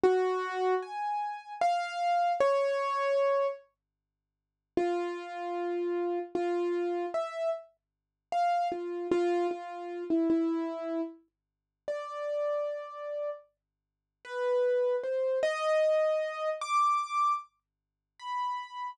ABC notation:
X:1
M:6/8
L:1/16
Q:3/8=51
K:none
V:1 name="Acoustic Grand Piano"
_G4 _a4 f4 | _d6 z6 | F8 F4 | e2 z4 f2 F2 F2 |
F3 E E4 z4 | d8 z4 | B4 c2 _e6 | d'4 z4 b4 |]